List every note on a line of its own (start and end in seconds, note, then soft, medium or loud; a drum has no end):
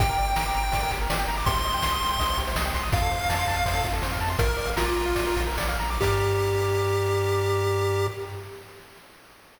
0.00 0.15 G1 loud
0.00 0.08 G4 loud
0.00 0.91 G5 medium
0.00 kick loud
0.00 ride loud
0.09 0.17 A#4 medium
0.18 0.34 G1 medium
0.18 0.26 D5 medium
0.18 ride medium
0.28 0.36 G5 medium
0.36 0.52 G1 loud
0.36 0.44 A#5 medium
0.36 snare loud
0.46 0.54 D6 medium
0.55 0.70 G1 loud
0.55 0.63 A#5 medium
0.55 ride medium
0.63 0.72 G5 medium
0.72 0.89 G1 medium
0.72 0.81 D5 medium
0.72 kick loud
0.72 ride loud
0.83 0.91 A#4 medium
0.90 1.07 G1 loud
0.90 1.00 G4 medium
0.90 kick medium
0.90 ride medium
1.01 1.09 A#4 medium
1.10 1.25 G1 medium
1.10 1.18 D5 loud
1.10 snare loud
1.19 1.28 G5 loud
1.28 1.43 G1 medium
1.28 1.36 A#5 medium
1.28 ride medium
1.37 1.46 D6 medium
1.46 1.62 C2 loud
1.46 1.54 G4 loud
1.46 2.39 C6 medium
1.46 kick loud
1.46 ride loud
1.56 1.64 C5 medium
1.64 1.80 C2 loud
1.64 1.73 D#5 medium
1.64 ride medium
1.74 1.82 G5 medium
1.82 1.98 C2 medium
1.82 1.91 C6 loud
1.82 snare loud
1.92 2.00 D#6 medium
2.01 2.17 C2 loud
2.01 2.10 C6 medium
2.01 ride medium
2.11 2.19 G5 medium
2.19 2.35 C2 loud
2.19 2.28 D#5 loud
2.19 kick medium
2.19 ride loud
2.29 2.37 C5 medium
2.37 2.54 C2 loud
2.37 2.46 G4 medium
2.37 kick medium
2.37 ride medium
2.47 2.55 C5 loud
2.56 2.71 C2 loud
2.56 2.64 D#5 loud
2.56 snare loud
2.65 2.73 G5 medium
2.73 2.90 C2 medium
2.73 2.83 C6 loud
2.73 kick medium
2.73 ride medium
2.83 2.91 D#6 medium
2.92 3.08 F2 loud
2.92 3.01 F4 loud
2.92 3.87 F5 medium
2.92 kick loud
2.92 ride loud
3.02 3.10 A4 medium
3.11 3.26 F2 loud
3.11 3.19 C5 medium
3.11 ride medium
3.21 3.29 F5 medium
3.29 3.45 F2 medium
3.29 3.38 A5 loud
3.29 snare loud
3.39 3.47 C6 medium
3.47 3.63 F2 loud
3.47 3.56 A5 loud
3.47 kick loud
3.47 ride medium
3.57 3.65 F5 medium
3.66 3.81 F2 medium
3.66 3.74 C5 loud
3.66 kick loud
3.66 ride loud
3.75 3.83 A4 medium
3.84 4.00 F2 medium
3.84 3.93 F4 medium
3.84 kick loud
3.84 ride medium
3.93 4.01 A4 medium
4.02 4.18 F2 loud
4.02 4.11 C5 loud
4.02 snare loud
4.12 4.20 F5 medium
4.21 4.36 F2 medium
4.21 4.29 A5 medium
4.21 ride medium
4.30 4.38 C6 medium
4.39 4.55 A#1 loud
4.39 4.47 F4 loud
4.39 4.70 A#4 medium
4.39 kick loud
4.39 ride loud
4.48 4.57 A#4 medium
4.57 4.74 A#1 medium
4.57 4.66 D5 medium
4.57 ride medium
4.67 4.76 F5 medium
4.76 4.93 A#1 medium
4.76 5.43 F4 medium
4.76 4.85 A#5 loud
4.76 snare loud
4.86 4.95 D6 medium
4.96 5.13 A#1 medium
4.96 5.05 A#5 medium
4.96 ride medium
5.06 5.15 F5 medium
5.15 5.33 A#1 medium
5.15 5.25 D5 loud
5.15 kick loud
5.15 ride loud
5.26 5.36 A#4 medium
5.36 5.54 A#1 loud
5.36 5.46 F4 medium
5.36 kick loud
5.36 ride medium
5.47 5.57 A#4 medium
5.58 5.76 A#1 medium
5.58 5.67 D5 loud
5.58 snare loud
5.69 5.78 F5 medium
5.79 5.98 A#1 loud
5.79 5.90 A#5 medium
5.79 ride medium
5.90 6.00 D6 medium
6.01 8.08 G2 loud
6.01 8.07 G4 loud
6.01 8.08 G4 medium
6.01 8.08 A#4 loud
6.01 8.08 D5 medium
6.01 kick loud
6.01 crash loud